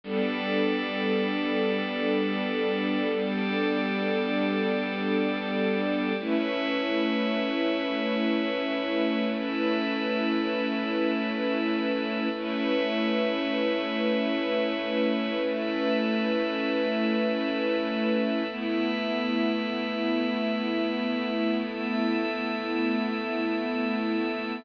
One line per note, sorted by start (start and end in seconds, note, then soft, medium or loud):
0.04 6.13 G3 medium
0.04 3.08 G3 loud
0.04 6.13 B3 medium
0.04 6.13 D4 medium
0.04 6.13 A4 medium
0.04 3.08 A4 loud
0.04 3.08 B4 loud
0.04 3.08 D5 medium
3.12 6.16 G3 loud
3.12 6.16 G4 medium
3.12 6.16 A4 medium
3.12 6.16 D5 medium
6.19 12.28 A3 medium
6.19 9.24 A3 loud
6.19 12.28 C#4 medium
6.19 12.28 E4 medium
6.19 12.28 B4 medium
6.19 9.24 B4 medium
6.19 9.24 C#5 loud
6.19 9.24 E5 medium
9.27 12.32 A3 loud
9.27 12.32 A4 loud
9.27 12.32 B4 medium
9.27 12.32 E5 medium
12.34 18.43 A3 medium
12.34 15.39 A3 loud
12.34 18.43 C#4 medium
12.34 18.43 E4 medium
12.34 18.43 B4 medium
12.34 15.39 B4 loud
12.34 15.39 C#5 loud
12.34 15.39 E5 medium
15.42 18.47 A3 loud
15.42 18.47 A4 medium
15.42 18.47 B4 medium
15.42 18.47 E5 medium
18.50 21.55 A3 medium
18.50 24.59 A3 medium
18.50 24.59 B3 medium
18.50 24.59 E4 medium
18.50 21.55 B4 medium
18.50 21.55 E5 loud
21.58 24.62 A3 loud
21.58 24.62 A4 loud
21.58 24.62 E5 medium